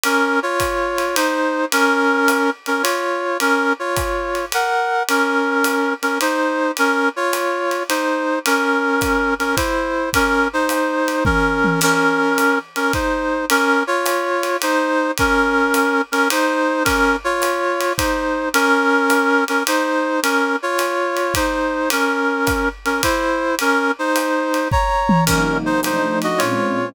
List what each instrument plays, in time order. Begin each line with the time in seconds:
0.04 brass section C#4 A#4, ride
0.43 brass section F4 C#5
0.60 kick, hi-hat pedal, ride
0.98 ride
1.16 brass section D#4 C5, ride
1.72 brass section C#4 A#4, ride
2.28 hi-hat pedal, ride
2.66 brass section C#4 A#4, ride
2.83 brass section F4 C#5, ride
3.40 brass section C#4 A#4, ride
3.79 brass section F4 C#5
3.96 kick, hi-hat pedal, ride
4.35 ride
4.52 brass section A#4 F#5, ride
5.09 brass section C#4 A#4, ride
5.64 hi-hat pedal, ride
6.02 brass section C#4 A#4, ride
6.21 brass section D#4 C5, ride
6.77 brass section C#4 A#4, ride
7.16 brass section F4 C#5
7.33 hi-hat pedal, ride
7.71 ride
7.89 brass section D#4 C5, ride
8.46 brass section C#4 A#4, ride
9.01 kick, hi-hat pedal, ride
9.39 brass section C#4 A#4, ride
9.56 brass section E4 C5, kick, ride
10.13 brass section C#4 A#4, kick, ride
10.53 brass section D#4 C5
10.69 hi-hat pedal, ride
11.08 ride
11.25 brass section C#4 A#4, kick, high tom
11.64 high tom
11.81 brass section C#4 A#4, crash, ride
12.38 hi-hat pedal, ride
12.76 brass section C#4 A#4, ride
12.93 brass section D#4 C5, kick, ride
13.50 brass section C#4 A#4, ride
13.87 brass section F4 C#5
14.06 hi-hat pedal, ride
14.43 ride
14.62 brass section D#4 C5, ride
15.18 brass section C#4 A#4, kick, ride
15.74 hi-hat pedal, ride
16.12 brass section C#4 A#4, ride
16.30 brass section D#4 C5, ride
16.85 brass section C#4 A#4, kick, ride
17.24 brass section F4 C#5
17.42 hi-hat pedal, ride
17.81 ride
17.98 brass section D#4 C5, kick, ride
18.54 brass section C#4 A#4, ride
19.10 hi-hat pedal, ride
19.48 brass section C#4 A#4, ride
19.67 brass section D#4 C5, ride
20.23 brass section C#4 A#4, ride
20.63 brass section F4 C#5
20.79 hi-hat pedal, ride
21.17 ride
21.34 brass section D#4 C5, kick, ride
21.90 brass section C#4 A#4, ride
22.47 kick, hi-hat pedal, ride
22.85 brass section C#4 A#4, ride
23.03 brass section E4 C5, kick, ride
23.59 brass section C#4 A#4, ride
23.99 brass section D#4 C5
24.16 hi-hat pedal, ride
24.54 ride
24.71 brass section C#5 A#5, kick
25.09 high tom
25.26 pad 2 (warm) C3 F#3 A#3 D#4, brass section C#4 A#4, kick, crash, ride
25.66 brass section D#4 C5
25.83 pad 2 (warm) F3 A3 D4 D#4, brass section D#4 C5, hi-hat pedal, ride
26.22 brass section F#4 D#5, ride
26.38 pad 2 (warm) A#2 G#3 C4 C#4, brass section F4 C#5, ride